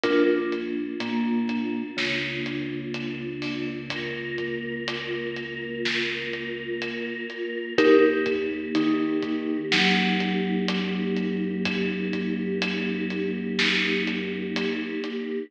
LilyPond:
<<
  \new Staff \with { instrumentName = "Vibraphone" } { \time 4/4 \key ees \major \tempo 4 = 62 <d' f' bes'>8 r8 bes4 des2~ | des1 | <ees' g' bes'>8 r8 ees'4 ges2~ | ges1 | }
  \new Staff \with { instrumentName = "Synth Bass 2" } { \clef bass \time 4/4 \key ees \major bes,,4 bes,4 des,2~ | des,1 | ees,4 ees4 ges,2~ | ges,1 | }
  \new Staff \with { instrumentName = "Choir Aahs" } { \time 4/4 \key ees \major <bes d' f'>1 | <bes f' bes'>1 | <bes ees' g'>1~ | <bes ees' g'>1 | }
  \new DrumStaff \with { instrumentName = "Drums" } \drummode { \time 4/4 <hh bd>8 hh8 hh8 <hh bd>8 sn8 hh8 hh8 hho8 | <hh bd>8 <hh bd>8 hh8 hh8 sn8 hh8 hh8 hh8 | <hh bd>8 <hh bd>8 hh8 <hh bd>8 sn8 hh8 hh8 hh8 | <hh bd>8 <hh bd>8 hh8 hh8 sn8 hh8 hh8 hh8 | }
>>